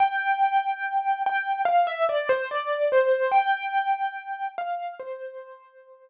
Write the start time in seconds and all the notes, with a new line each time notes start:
0.00 G5
1.26 G5
1.65 F5
1.87 E5
2.09 D5
2.29 C5
2.51 D5
2.92 C5
3.32 G5
4.58 F5
4.99 C5